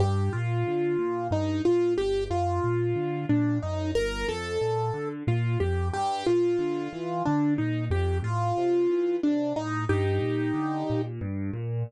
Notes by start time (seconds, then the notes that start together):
0.00 G2 G4
0.33 A#2 F4
0.67 D3
0.99 A#2
1.31 G2 D#4
1.65 A#2 F4
1.98 G1 G4
2.30 F#2 F4
2.64 A#2
2.96 D3
3.29 A#2 D4
3.63 F#2 D#4
3.95 G1 A#4
4.28 F2 A4
4.61 A#2
4.94 D3
5.27 A#2 F4
5.60 F2 G4
5.93 G2 G4
6.27 A#2 F4
6.59 D3
6.93 E3
7.25 D3 D4
7.58 A#2 D#4
7.91 F2 G4
8.22 A2 F4
8.58 C3
8.90 E3
9.23 C3 D4
9.56 A2 D#4
9.89 G2 D#4 G4
10.22 A#2
10.54 D3
10.90 A#2
11.21 G2
11.53 A#2